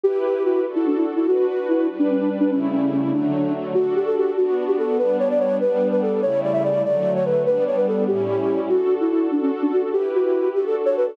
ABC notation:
X:1
M:6/8
L:1/16
Q:3/8=97
K:D
V:1 name="Flute"
G2 G2 F2 z E D E z E | F2 F2 E2 z D C D z D | C2 C2 C2 D4 z2 | F2 G A G2 F3 G A2 |
B2 c d c2 B3 B A2 | c2 d e d2 d3 c B2 | B2 c B A2 G6 | F3 E E2 D C z D F z |
G2 F4 G A z c B A |]
V:2 name="String Ensemble 1"
[EGB]6 [DFA]6 | [DFB]6 [G,DB]6 | [C,G,A,E]6 [D,F,A,]6 | [DFA]6 [B,DF]6 |
[G,B,D]6 [G,B,D]6 | [C,G,A,E]6 [D,F,A,]6 | [G,B,D]6 [A,,G,CE]6 | [DFA]6 [DFA]6 |
[EGB]6 [DFA]6 |]